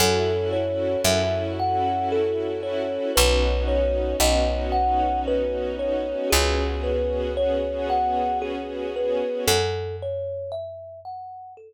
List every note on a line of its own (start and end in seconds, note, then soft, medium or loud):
0.00 0.96 F#2 medium
0.00 3.12 C#4 medium
0.00 3.12 E4 loud
0.00 3.12 F#4 medium
0.00 3.12 A4 medium
0.00 0.49 A4 loud
0.53 1.01 C#5 medium
1.04 2.98 F#2 medium
1.04 1.53 E5 loud
1.59 2.08 F#5 medium
2.12 2.60 A4 medium
2.63 3.11 C#5 medium
3.16 4.14 B1 medium
3.16 6.29 B3 medium
3.16 6.29 C#4 medium
3.16 6.29 D#4 medium
3.16 6.29 F#4 medium
3.16 3.64 B4 medium
3.68 4.16 C#5 medium
4.20 6.14 B1 medium
4.20 4.69 D#5 loud
4.72 5.20 F#5 medium
5.28 5.76 B4 medium
5.79 6.28 C#5 medium
6.30 9.23 C#2 medium
6.30 9.46 B3 medium
6.30 9.46 C#4 medium
6.30 9.46 F#4 medium
6.30 6.79 G#4 medium
6.30 9.46 G#4 loud
6.83 7.32 B4 medium
7.37 7.85 C#5 medium
7.90 8.38 F#5 medium
8.42 8.90 G#4 medium
8.96 9.45 B4 medium
9.47 11.73 F#2 medium
9.47 9.96 A4 loud
10.02 10.51 C#5 medium
10.52 11.00 E5 loud
11.05 11.54 F#5 medium
11.57 11.73 A4 loud